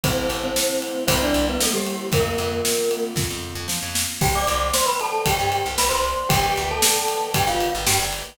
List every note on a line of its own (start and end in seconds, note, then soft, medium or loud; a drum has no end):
0.03 0.27 A1 medium
0.03 1.06 A3 medium
0.03 1.06 C4 medium
0.03 0.36 C4 medium
0.03 1.06 E4 loud
0.03 0.36 C5 medium
0.03 kick medium
0.03 ride medium
0.29 0.53 A1 medium
0.29 ride medium
0.44 0.98 C4 medium
0.44 0.98 C5 medium
0.56 snare medium
0.82 ride medium
1.07 1.31 C2 loud
1.07 2.11 G3 loud
1.07 2.11 A#3 loud
1.07 1.20 C4 medium
1.07 2.11 C4 medium
1.07 2.11 E4 medium
1.07 1.20 C5 medium
1.07 kick medium
1.07 ride medium
1.22 1.46 D4 medium
1.22 1.46 D5 medium
1.34 1.58 C2 medium
1.34 ride medium
1.49 1.62 B3 medium
1.49 1.62 B4 medium
1.60 1.74 A3 medium
1.60 1.74 A4 medium
1.60 snare medium
1.73 2.07 G3 medium
1.73 2.07 G4 medium
1.87 ride medium
2.12 2.35 F2 medium
2.12 4.17 A#3 medium
2.12 3.03 A#3 medium
2.12 4.17 C4 loud
2.12 4.17 F4 medium
2.12 3.03 A#4 medium
2.12 kick medium
2.12 ride medium
2.38 2.62 F2 medium
2.38 ride medium
2.65 snare medium
2.91 ride medium
3.16 3.27 F2 medium
3.16 kick medium
3.16 snare medium
3.30 3.54 F2 medium
3.55 3.67 F2 medium
3.68 3.80 F3 medium
3.68 snare medium
3.82 4.06 F2 medium
3.95 snare medium
4.21 4.45 C2 loud
4.21 4.34 G4 medium
4.21 6.26 C5 medium
4.21 6.26 D5 loud
4.21 6.26 G5 medium
4.21 4.34 G5 medium
4.21 kick medium
4.21 crash medium
4.35 4.67 D5 medium
4.35 4.67 D6 medium
4.47 4.72 C2 medium
4.47 ride medium
4.73 4.87 C5 medium
4.73 4.87 C6 medium
4.73 snare medium
4.86 4.98 B4 medium
4.86 4.98 B5 medium
5.00 5.22 A4 medium
5.00 5.22 A5 medium
5.00 ride medium
5.26 5.38 C2 medium
5.26 5.69 G4 medium
5.26 5.69 G5 medium
5.26 kick medium
5.26 ride medium
5.39 5.63 G2 medium
5.52 ride medium
5.66 5.77 C2 medium
5.78 5.90 C2 medium
5.78 5.91 B4 medium
5.78 5.91 B5 medium
5.78 snare medium
5.89 6.14 C2 medium
5.89 6.27 C5 medium
5.89 6.27 C6 medium
6.04 ride soft
6.29 6.54 G1 loud
6.29 6.63 G4 medium
6.29 8.35 B4 loud
6.29 8.35 D5 medium
6.29 6.63 G5 medium
6.29 8.35 G5 loud
6.29 kick medium
6.29 ride medium
6.56 6.81 D2 medium
6.56 ride medium
6.71 7.26 A4 medium
6.71 7.26 A5 medium
6.82 snare loud
7.08 ride medium
7.34 7.46 G2 medium
7.34 7.48 G4 medium
7.34 7.48 G5 medium
7.34 kick medium
7.34 ride medium
7.47 7.71 G1 medium
7.47 7.73 F4 medium
7.47 7.73 F5 medium
7.60 ride medium
7.75 7.86 G1 medium
7.87 7.99 G2 loud
7.87 7.99 G4 medium
7.87 7.99 G5 medium
7.87 snare medium
7.99 8.23 G1 medium
8.13 ride medium